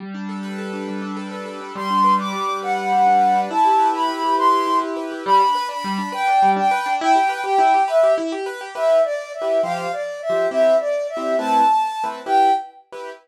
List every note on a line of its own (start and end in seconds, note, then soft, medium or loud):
0.00 0.87 G3 medium
0.14 0.73 D4 medium
0.29 0.58 A4 medium
0.43 1.31 B4 medium
0.58 1.16 A4 medium
0.73 1.01 D4 medium
0.88 1.71 G3 medium
1.02 1.60 D4 medium
1.17 1.45 A4 medium
1.31 1.73 B4 medium
1.46 1.74 A4 medium
1.61 1.75 D4 medium
1.75 2.32 G3 loud
1.75 2.14 C6 medium
1.90 2.18 D4 medium
2.04 2.62 B4 medium
2.19 2.48 D4 medium
2.19 2.58 D6 medium
2.33 2.92 G3 medium
2.49 2.77 D4 medium
2.62 3.21 B4 medium
2.62 3.39 F#5 medium
2.77 3.06 D4 medium
2.92 3.48 G3 medium
3.06 3.35 D4 medium
3.21 3.49 B4 medium
3.35 3.49 D4 medium
3.50 4.08 E4 loud
3.50 3.88 A5 medium
3.65 3.93 G4 medium
3.79 4.38 B4 medium
3.94 4.23 G4 medium
3.94 4.35 B5 medium
4.09 4.66 E4 medium
4.24 4.52 G4 medium
4.38 4.96 B4 medium
4.38 4.77 C6 medium
4.53 4.81 G4 medium
4.67 5.22 E4 medium
4.82 5.11 G4 medium
4.97 5.24 B4 medium
5.11 5.25 G4 medium
5.25 5.41 G3 loud
5.25 5.67 B5 loud
5.40 5.55 D4 loud
5.55 5.69 B4 loud
5.69 5.83 D4 medium
5.69 6.09 B5 medium
5.84 5.99 G3 loud
5.98 6.13 D4 medium
6.12 6.27 B4 loud
6.12 6.50 G5 loud
6.27 6.42 D4 loud
6.42 6.57 G3 loud
6.56 6.71 D4 loud
6.56 6.93 G5 medium
6.71 6.86 B4 loud
6.86 7.00 D4 loud
7.01 7.16 E4 loud
7.01 7.41 G5 loud
7.15 7.30 G4 loud
7.29 7.44 B4 loud
7.44 7.58 G4 loud
7.44 7.82 G5 medium
7.58 7.73 E4 loud
7.74 7.89 G4 loud
7.88 8.02 B4 loud
7.88 8.13 E5 medium
8.03 8.18 G4 loud
8.18 8.32 E4 loud
8.32 8.47 G4 loud
8.46 8.61 B4 loud
8.61 8.75 G4 loud
8.75 8.98 E4 medium
8.75 8.98 G4 medium
8.75 8.98 B4 medium
8.75 9.02 E5 medium
9.04 9.32 D5 medium
9.34 9.61 E5 medium
9.42 9.59 E4 medium
9.42 9.59 G4 medium
9.42 9.59 B4 medium
9.63 9.87 F3 medium
9.63 9.87 G4 medium
9.63 9.87 C5 medium
9.63 9.92 F5 loud
9.92 10.20 D5 medium
10.22 10.46 E5 medium
10.30 10.47 F3 medium
10.30 10.47 G4 medium
10.30 10.47 C5 medium
10.51 10.75 C4 medium
10.51 10.75 E4 medium
10.51 10.75 G4 medium
10.51 10.76 E5 loud
10.80 11.07 D5 medium
11.09 11.36 E5 medium
11.17 11.34 C4 medium
11.17 11.34 E4 medium
11.17 11.34 G4 medium
11.39 11.62 A3 medium
11.39 11.62 C4 medium
11.39 11.62 E4 medium
11.39 11.62 B4 medium
11.39 12.04 A5 loud
12.04 12.21 A3 medium
12.04 12.21 C4 medium
12.04 12.21 E4 medium
12.04 12.21 B4 medium
12.26 12.50 E4 medium
12.26 12.50 G4 medium
12.26 12.50 B4 medium
12.26 12.52 G5 loud
12.92 13.10 E4 medium
12.92 13.10 G4 medium
12.92 13.10 B4 medium